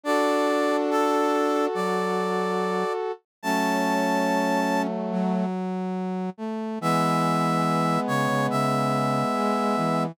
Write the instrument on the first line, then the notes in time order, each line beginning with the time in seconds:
brass section
0.04 D4 F#4 A4 D5
0.90 A4
1.74 F#3 D5
3.43 F#3 A3 C#4 A5
5.12 F#3
6.38 A3
6.81 E3 G#3 B3 E5
8.08 C#3 C#5
8.28 C#3
8.50 C#3 E5
9.34 G#3
9.77 E3